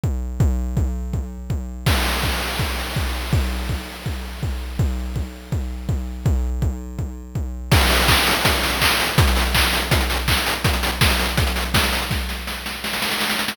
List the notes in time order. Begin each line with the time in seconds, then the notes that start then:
0.04 kick
0.40 kick
0.77 kick
1.13 kick
1.50 kick
1.86 kick, crash
2.23 kick
2.59 kick
2.96 kick
3.33 kick
3.69 kick
4.06 kick
4.43 kick
4.79 kick
5.16 kick
5.52 kick
5.89 kick
6.26 kick
6.62 kick
6.99 kick
7.35 kick
7.72 kick, crash
7.81 closed hi-hat
7.90 open hi-hat
7.99 closed hi-hat
8.08 kick, clap
8.17 closed hi-hat
8.27 open hi-hat
8.36 closed hi-hat
8.45 kick, closed hi-hat
8.54 closed hi-hat
8.63 open hi-hat
8.73 closed hi-hat
8.81 kick, clap
8.91 closed hi-hat
9.00 open hi-hat
9.09 closed hi-hat
9.18 kick, closed hi-hat
9.27 closed hi-hat
9.36 open hi-hat
9.45 closed hi-hat
9.55 kick, clap
9.64 closed hi-hat
9.73 open hi-hat
9.82 closed hi-hat
9.91 kick, closed hi-hat
10.01 closed hi-hat
10.10 open hi-hat
10.19 closed hi-hat
10.28 kick, clap
10.37 closed hi-hat
10.46 open hi-hat
10.55 closed hi-hat
10.64 kick, closed hi-hat
10.74 closed hi-hat
10.83 open hi-hat
10.92 closed hi-hat
11.01 kick, snare
11.10 closed hi-hat
11.19 open hi-hat
11.28 closed hi-hat
11.37 kick, closed hi-hat
11.47 closed hi-hat
11.56 open hi-hat
11.65 closed hi-hat
11.74 kick, snare
11.83 closed hi-hat
11.93 open hi-hat
12.02 closed hi-hat
12.11 kick, snare
12.29 snare
12.47 snare
12.66 snare
12.84 snare
12.93 snare
13.02 snare
13.11 snare
13.20 snare
13.29 snare
13.39 snare
13.48 snare